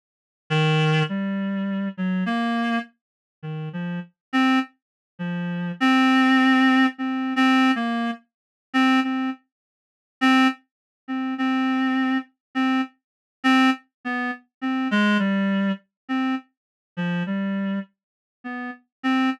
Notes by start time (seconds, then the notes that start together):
0.50 D#3
1.09 G3
1.98 F#3
2.26 A#3
3.43 D#3
3.73 F3
4.33 C4
5.19 F3
5.80 C4
6.98 C4
7.36 C4
7.76 A#3
8.74 C4
9.04 C4
10.21 C4
11.08 C4
11.38 C4
12.55 C4
13.44 C4
14.05 B3
14.62 C4
14.91 G#3
15.19 G3
16.09 C4
16.97 F3
17.26 G3
18.44 B3
19.03 C4